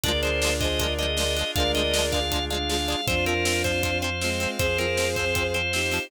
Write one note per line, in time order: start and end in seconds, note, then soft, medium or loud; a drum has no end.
0.03 1.44 D2 medium
0.03 0.12 G#3 loud
0.03 3.01 D4 medium
0.03 1.54 D4 medium
0.03 0.12 D4 loud
0.03 3.01 F4 loud
0.03 1.54 F4 medium
0.03 3.01 G#4 medium
0.03 1.54 G#4 medium
0.03 0.56 A#4 loud
0.03 0.21 D5 loud
0.03 0.56 D5 loud
0.03 kick medium
0.03 closed hi-hat loud
0.08 0.12 F3 loud
0.23 0.30 F3 medium
0.23 0.30 G#3 medium
0.23 0.30 D4 medium
0.23 0.54 C5 loud
0.23 closed hi-hat medium
0.42 0.50 G#3 loud
0.42 0.50 D4 loud
0.42 snare loud
0.47 0.50 F3 loud
0.60 0.68 G#3 loud
0.60 0.68 D4 loud
0.60 0.78 G#4 medium
0.60 0.78 C5 loud
0.60 0.94 D#5 loud
0.60 kick medium
0.60 closed hi-hat medium
0.64 0.68 F3 medium
0.79 0.87 G#3 loud
0.79 0.87 D4 loud
0.79 1.10 A#4 medium
0.79 1.10 D5 loud
0.79 kick medium
0.79 closed hi-hat medium
0.83 0.87 F3 loud
0.98 1.06 F3 loud
0.98 1.06 G#3 medium
0.98 1.06 D4 medium
0.98 1.51 D#5 loud
0.98 closed hi-hat medium
1.17 1.24 G#3 medium
1.17 1.24 D4 medium
1.17 1.34 A#4 medium
1.17 1.34 D5 loud
1.17 snare loud
1.21 1.24 F3 loud
1.37 1.44 G#3 loud
1.37 1.44 D4 medium
1.37 closed hi-hat medium
1.41 1.44 F3 medium
1.55 2.95 D2 medium
1.55 3.07 G#3 medium
1.55 1.63 G#3 medium
1.55 1.63 D4 loud
1.55 3.07 D4 medium
1.55 3.07 G#4 medium
1.55 2.18 A#4 loud
1.55 2.18 D5 loud
1.55 1.72 F5 loud
1.55 kick loud
1.55 closed hi-hat medium
1.60 1.63 F3 loud
1.75 1.82 G#3 loud
1.75 1.82 D4 medium
1.75 2.05 D#5 loud
1.75 closed hi-hat medium
1.79 1.82 F3 medium
1.94 2.02 G#3 loud
1.94 2.02 D4 medium
1.94 snare loud
1.98 2.02 F3 medium
2.12 2.20 G#3 medium
2.12 2.20 D4 loud
2.12 2.45 F5 loud
2.12 kick medium
2.12 closed hi-hat medium
2.16 2.20 F3 medium
2.32 2.39 F3 medium
2.32 2.39 G#3 medium
2.32 2.39 D4 medium
2.32 kick medium
2.32 closed hi-hat medium
2.50 2.58 G#3 medium
2.50 2.58 D4 loud
2.50 3.06 F5 loud
2.50 closed hi-hat medium
2.54 2.58 F3 medium
2.69 2.77 F3 medium
2.69 2.77 G#3 medium
2.69 2.77 D4 medium
2.69 snare medium
2.88 2.96 F3 medium
2.88 2.96 G#3 loud
2.88 2.96 D4 loud
2.88 closed hi-hat medium
3.07 4.47 F2 medium
3.07 3.15 F3 loud
3.07 3.15 C4 loud
3.07 6.09 C4 medium
3.07 4.04 D4 loud
3.07 4.04 F4 loud
3.07 6.09 F4 medium
3.07 3.25 C5 loud
3.07 6.05 C5 loud
3.07 6.05 F5 medium
3.07 kick loud
3.07 closed hi-hat medium
3.26 3.34 F3 loud
3.26 3.34 C4 loud
3.26 3.62 A#4 loud
3.26 closed hi-hat medium
3.45 3.53 F3 medium
3.45 3.53 C4 loud
3.45 snare loud
3.64 3.72 F3 loud
3.64 3.72 C4 loud
3.64 3.98 C5 loud
3.64 kick medium
3.64 closed hi-hat medium
3.83 3.91 F3 loud
3.83 3.91 C4 loud
3.83 kick medium
3.83 closed hi-hat medium
4.02 4.10 F3 loud
4.02 4.10 C4 loud
4.02 4.51 C5 medium
4.02 closed hi-hat medium
4.21 4.30 F3 medium
4.21 4.57 G#3 loud
4.21 4.57 C4 loud
4.21 4.30 C4 medium
4.21 snare medium
4.40 4.48 F3 loud
4.40 4.48 C4 loud
4.40 closed hi-hat medium
4.59 5.99 F2 medium
4.59 4.67 F3 medium
4.59 4.67 C4 loud
4.59 5.55 G#4 loud
4.59 5.55 C5 loud
4.59 4.78 C5 loud
4.59 kick medium
4.59 closed hi-hat medium
4.78 4.86 F3 loud
4.78 4.86 C4 loud
4.78 5.09 A#4 loud
4.78 closed hi-hat medium
4.97 5.05 F3 medium
4.97 5.05 C4 loud
4.97 snare medium
5.16 5.25 F3 medium
5.16 5.25 C4 medium
5.16 5.47 C5 loud
5.16 kick medium
5.16 closed hi-hat medium
5.35 5.43 F3 medium
5.35 5.43 C4 loud
5.35 kick medium
5.35 closed hi-hat medium
5.54 5.62 F3 medium
5.54 5.62 C4 medium
5.54 6.07 C5 loud
5.54 closed hi-hat medium
5.73 5.81 F3 medium
5.73 5.81 C4 medium
5.73 6.10 D#4 medium
5.73 6.10 G4 medium
5.73 snare medium
5.91 5.99 F3 loud
5.91 5.99 C4 medium
5.91 open hi-hat medium